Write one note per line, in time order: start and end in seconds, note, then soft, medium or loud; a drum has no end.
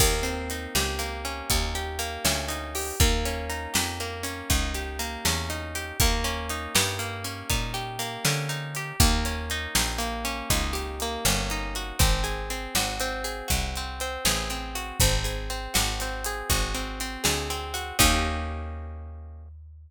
0.00 0.67 D#2 medium
0.00 0.98 A#3 loud
0.00 kick loud
0.00 crash loud
0.23 2.48 C4 medium
0.23 closed hi-hat medium
0.50 1.50 D#4 medium
0.50 closed hi-hat medium
0.75 1.42 C#2 medium
0.75 1.74 G4 medium
0.75 snare loud
0.99 1.98 A#3 medium
0.99 closed hi-hat medium
1.25 2.24 C#4 medium
1.25 closed hi-hat medium
1.50 2.18 D#2 medium
1.50 2.48 D#4 medium
1.50 kick loud
1.50 closed hi-hat loud
1.75 2.75 G4 medium
1.75 closed hi-hat medium
1.99 2.94 A#3 loud
1.99 closed hi-hat medium
2.25 2.92 D2 medium
2.25 2.96 C#4 medium
2.25 snare loud
2.48 2.96 D#4 medium
2.48 closed hi-hat medium
2.75 2.99 G4 medium
2.75 open hi-hat medium
3.00 3.67 D#2 medium
3.00 4.00 A#3 loud
3.00 kick loud
3.00 closed hi-hat loud
3.25 4.23 C#4 medium
3.25 closed hi-hat medium
3.49 4.50 D#4 medium
3.49 closed hi-hat medium
3.74 4.42 F2 medium
3.74 4.74 G4 medium
3.74 snare loud
4.00 4.99 A#3 medium
4.00 closed hi-hat medium
4.23 5.26 C#4 medium
4.23 closed hi-hat medium
4.50 5.17 C#2 medium
4.50 5.49 D#4 medium
4.50 kick medium
4.50 closed hi-hat loud
4.74 5.75 G4 medium
4.74 closed hi-hat medium
4.99 5.94 A#3 medium
4.99 closed hi-hat medium
5.25 5.92 E2 medium
5.25 5.97 C#4 medium
5.25 snare loud
5.50 5.97 D#4 medium
5.50 closed hi-hat medium
5.75 5.99 G4 medium
5.75 closed hi-hat medium
6.00 6.68 D#2 medium
6.00 6.98 A#3 loud
6.00 kick loud
6.00 closed hi-hat loud
6.24 7.24 C#4 loud
6.24 closed hi-hat medium
6.49 7.49 D#4 medium
6.49 closed hi-hat medium
6.75 7.43 G2 medium
6.75 7.73 G4 medium
6.75 snare loud
6.99 7.98 A#3 medium
6.99 closed hi-hat medium
7.24 8.25 C#4 medium
7.24 closed hi-hat medium
7.50 8.18 A#2 medium
7.50 8.49 D#4 medium
7.50 kick medium
7.50 closed hi-hat loud
7.74 8.76 G4 medium
7.74 closed hi-hat medium
7.99 8.94 A#3 medium
7.99 closed hi-hat medium
8.25 8.93 D3 medium
8.25 8.96 C#4 medium
8.25 snare loud
8.49 8.97 D#4 medium
8.49 closed hi-hat medium
8.75 9.00 G4 medium
8.75 closed hi-hat medium
9.00 9.67 D#2 medium
9.00 9.98 A#3 loud
9.00 kick loud
9.00 closed hi-hat loud
9.25 10.24 C#4 medium
9.25 closed hi-hat medium
9.50 10.50 D#4 loud
9.50 closed hi-hat medium
9.75 10.43 A#1 medium
9.75 10.73 G4 medium
9.75 snare loud
9.98 11.01 A#3 medium
9.98 closed hi-hat medium
10.25 11.25 C#4 loud
10.25 closed hi-hat medium
10.50 11.18 C#2 medium
10.50 11.51 D#4 medium
10.50 kick medium
10.50 closed hi-hat loud
10.73 11.92 G4 medium
10.73 closed hi-hat medium
11.00 11.97 A#3 loud
11.00 closed hi-hat medium
11.25 11.93 G1 medium
11.25 11.96 C#4 medium
11.25 snare loud
11.50 11.99 D#4 medium
11.50 closed hi-hat medium
11.75 11.99 F#4 medium
11.75 closed hi-hat medium
11.99 12.68 G#1 medium
11.99 12.50 C4 loud
11.99 kick loud
11.99 closed hi-hat loud
12.24 13.24 G#4 medium
12.24 closed hi-hat medium
12.50 13.00 C4 medium
12.50 closed hi-hat medium
12.75 13.42 G#1 medium
12.75 13.47 F#4 medium
12.75 snare loud
13.00 13.76 C4 loud
13.00 closed hi-hat medium
13.24 14.25 G#4 medium
13.24 closed hi-hat medium
13.48 14.18 C2 medium
13.48 14.75 F#4 medium
13.48 kick medium
13.48 closed hi-hat loud
13.76 14.01 C4 medium
13.76 closed hi-hat medium
14.00 14.50 C4 medium
14.00 closed hi-hat medium
14.25 14.92 A1 medium
14.25 14.97 G#4 medium
14.25 snare loud
14.50 14.98 C4 medium
14.50 closed hi-hat medium
14.75 14.99 F#4 medium
14.75 closed hi-hat medium
15.00 15.68 G#1 medium
15.00 15.49 C4 medium
15.00 kick loud
15.00 closed hi-hat loud
15.24 16.25 G#4 medium
15.24 closed hi-hat medium
15.50 16.01 C4 medium
15.50 closed hi-hat medium
15.74 16.43 G#1 medium
15.74 16.49 F#4 medium
15.74 snare loud
16.00 16.74 C4 medium
16.00 closed hi-hat medium
16.24 17.23 G#4 medium
16.24 closed hi-hat loud
16.49 17.17 G#1 medium
16.49 17.73 F#4 medium
16.49 kick loud
16.49 closed hi-hat loud
16.74 17.00 C4 medium
16.74 closed hi-hat medium
17.00 17.50 C4 medium
17.00 closed hi-hat medium
17.24 17.92 D2 medium
17.24 17.95 G#4 medium
17.24 snare loud
17.50 17.98 C4 medium
17.50 closed hi-hat medium
17.74 17.98 F#4 medium
17.74 closed hi-hat medium
17.99 19.91 D#2 loud
17.99 19.91 A#3 loud
17.99 19.91 C#4 loud
17.99 19.91 D#4 loud
17.99 19.91 G4 medium
17.99 kick loud
17.99 crash loud